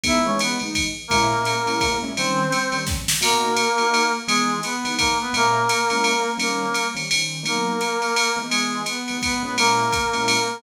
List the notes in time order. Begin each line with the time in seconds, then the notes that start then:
0.04 E3 G#3 B3 D#4 E4 E5, kick, ride
0.26 E3 G#3 B3 C#4 D#4 C#5
0.39 B3 B4, hi-hat pedal, ride
0.59 E3 G#3 B3 D#4, ride
0.75 kick, ride
1.08 A#2 G#3 A#3 C#4 E4 A#4, kick, ride
1.30 A#2 G#3 C#4 E4
1.45 hi-hat pedal, ride
1.66 A#2 G#3 C#4 E4, ride
1.80 kick, ride
2.02 A#2 G#3 C#4 E4
2.17 D#3 G3 C4 C#4 C5, ride
2.52 hi-hat pedal, ride
2.72 D#3 G3 C4 C#4, ride
2.87 kick, snare
3.08 snare
3.21 B2 A#3 D#4 F#4 A#4, crash, ride
3.56 hi-hat pedal, ride
3.78 B2 A#3 D#4 F#4, ride
3.94 ride
4.27 E3 G#3 B3 D#4 G#4, ride
4.63 B3 B4, hi-hat pedal, ride
4.85 E3 G#3 B3 D#4, ride
4.98 A#3 A#4, kick, ride
5.21 B3 B4
5.33 A#2 G#3 A#3 C#4 E4 A#4, ride
5.69 hi-hat pedal, ride
5.90 A#2 G#3 C#4 E4, ride
6.04 ride
6.38 D#3 G3 A#3 C4 C#4 A#4, ride
6.74 hi-hat pedal, ride
6.95 D#3 G3 C4 C#4, ride
7.11 D#3 G3 C4 C#4, ride
7.43 B2 F#3 A#3 D#4 A#4, ride
7.81 hi-hat pedal, ride
8.02 ride
8.16 ride
8.36 E3 G#3 B3 D#4
8.49 G#3 G#4, ride
8.86 B3 B4, hi-hat pedal, ride
9.08 E3 G#3 B3 D#4, ride
9.22 B3 B4, kick, ride
9.43 A#2 G#3 B3 C#4 E4 B4
9.58 A#3 A#4, ride
9.92 kick, hi-hat pedal, ride
10.13 A#2 G#3 C#4 E4, ride
10.28 ride